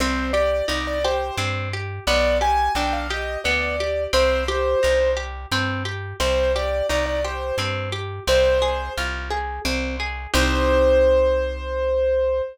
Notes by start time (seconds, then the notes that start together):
0.00 C2 C4 C5
0.33 G4 D5
0.68 C2 D#4 D5
0.87 D5
1.04 G4 C5
1.37 G2 C4
1.73 G4
2.07 B1 B3 D5
2.41 G4 G#5
2.75 B1 D4 G5
2.93 F5
3.10 G4 D#5
3.44 D2 B3 D5
3.80 G4
4.13 C2 C4 C5
4.48 G4
4.83 C2 D#4
5.17 G4
5.51 G2 C4
5.85 G4
6.20 C2 C4 C5
6.55 G4 D5
6.89 C2 D#4 D5
7.06 D5
7.24 G4 C5
7.58 G2 C4
7.92 G4
8.27 C2 C4 C5
8.62 G#4
8.97 C2 F4
9.30 G#4
9.65 C2 C4
10.00 G#4
10.34 C2 C4 D#4 G4 C5